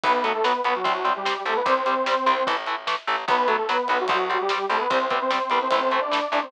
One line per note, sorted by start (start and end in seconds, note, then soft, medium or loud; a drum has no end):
0.04 0.56 B1 loud
0.04 0.12 F#3 loud
0.04 0.12 B3 loud
0.04 0.23 B3 medium
0.04 0.23 B4 medium
0.04 kick medium
0.04 ride medium
0.23 0.32 F#3 loud
0.23 0.33 A3 medium
0.23 0.32 B3 loud
0.23 0.33 A4 medium
0.23 ride medium
0.35 0.44 A3 medium
0.35 0.44 A4 medium
0.44 0.52 F#3 loud
0.44 0.61 B3 medium
0.44 0.52 B3 medium
0.44 0.61 B4 medium
0.44 snare medium
0.64 0.82 B1 medium
0.64 0.73 F#3 medium
0.64 0.74 B3 medium
0.64 0.73 B3 medium
0.64 0.74 B4 medium
0.64 ride medium
0.75 1.10 F#3 medium
0.75 1.10 F#4 medium
0.84 1.37 C2 medium
0.84 0.92 G3 loud
0.84 0.92 C4 loud
0.84 kick medium
0.84 ride medium
1.05 1.13 G3 medium
1.05 1.13 C4 medium
1.05 ride medium
1.16 1.42 G3 medium
1.16 1.42 G4 medium
1.25 1.34 G3 medium
1.25 1.34 C4 loud
1.25 snare medium
1.46 1.63 C2 medium
1.46 1.54 G3 loud
1.46 1.57 A3 medium
1.46 1.54 C4 medium
1.46 1.57 A4 medium
1.46 ride medium
1.56 1.66 B3 medium
1.56 1.66 B4 medium
1.66 2.18 C2 medium
1.66 1.74 G3 loud
1.66 1.74 C4 loud
1.66 2.46 C4 medium
1.66 2.46 C5 medium
1.66 kick medium
1.66 ride medium
1.86 1.94 G3 medium
1.86 1.94 C4 medium
1.86 ride medium
2.06 2.15 G3 medium
2.06 2.15 C4 medium
2.06 snare medium
2.26 2.44 C2 medium
2.26 2.34 G3 medium
2.26 2.34 C4 medium
2.26 ride medium
2.47 2.99 A1 medium
2.47 2.55 E3 loud
2.47 2.55 A3 loud
2.47 kick medium
2.47 ride medium
2.66 2.75 E3 medium
2.66 2.75 A3 medium
2.66 ride medium
2.87 2.95 E3 loud
2.87 2.95 A3 medium
2.87 snare medium
3.07 3.25 A1 medium
3.07 3.16 E3 medium
3.07 3.16 A3 loud
3.07 ride medium
3.28 3.80 B1 loud
3.28 3.36 F#3 loud
3.28 3.36 B3 medium
3.28 3.47 B3 medium
3.28 3.47 B4 medium
3.28 kick medium
3.28 ride medium
3.47 3.56 F#3 loud
3.47 3.57 A3 medium
3.47 3.56 B3 medium
3.47 3.57 A4 medium
3.47 ride medium
3.57 3.67 A3 medium
3.57 3.67 A4 medium
3.69 3.77 F#3 loud
3.69 3.88 B3 medium
3.69 3.77 B3 medium
3.69 3.88 B4 medium
3.69 snare medium
3.88 4.07 B1 medium
3.88 3.97 F#3 medium
3.88 3.98 B3 medium
3.88 3.97 B3 medium
3.88 3.98 B4 medium
3.88 ride medium
4.00 4.40 F#3 medium
4.00 4.40 F#4 medium
4.08 4.61 C2 loud
4.08 4.17 G3 loud
4.08 4.17 C4 loud
4.08 kick medium
4.08 ride medium
4.30 4.38 G3 medium
4.30 4.38 C4 medium
4.30 ride medium
4.41 4.66 G3 medium
4.41 4.66 G4 medium
4.49 4.58 G3 medium
4.49 4.58 C4 medium
4.49 snare medium
4.70 4.87 C2 medium
4.70 4.78 G3 medium
4.70 4.80 A3 medium
4.70 4.78 C4 medium
4.70 4.80 A4 medium
4.70 ride medium
4.80 4.90 B3 medium
4.80 4.90 B4 medium
4.90 5.42 C2 loud
4.90 4.98 G3 loud
4.90 5.06 C4 medium
4.90 4.98 C4 loud
4.90 5.06 C5 medium
4.90 kick medium
4.90 ride medium
5.10 5.19 G3 medium
5.10 5.20 B3 medium
5.10 5.19 C4 medium
5.10 5.20 B4 medium
5.10 kick medium
5.10 ride medium
5.21 5.31 C4 medium
5.21 5.31 C5 medium
5.31 5.39 G3 loud
5.31 5.39 C4 medium
5.31 5.49 C4 medium
5.31 5.49 C5 medium
5.31 snare medium
5.50 5.68 C2 medium
5.50 5.59 G3 medium
5.50 5.60 B3 medium
5.50 5.59 C4 medium
5.50 5.60 B4 medium
5.50 ride medium
5.62 6.00 C4 medium
5.62 6.00 C5 medium
5.71 6.23 A1 medium
5.71 5.80 E3 loud
5.71 5.80 A3 loud
5.71 kick medium
5.71 ride medium
5.91 6.00 E3 medium
5.91 6.00 A3 medium
5.91 ride soft
6.01 6.28 D4 medium
6.01 6.28 D5 medium
6.11 6.20 E3 medium
6.11 6.20 A3 medium
6.11 snare medium
6.32 6.49 A1 medium
6.32 6.40 E3 loud
6.32 6.40 A3 medium
6.32 6.43 D4 medium
6.32 6.43 D5 medium
6.32 ride medium
6.42 6.52 C4 medium
6.42 6.52 C5 medium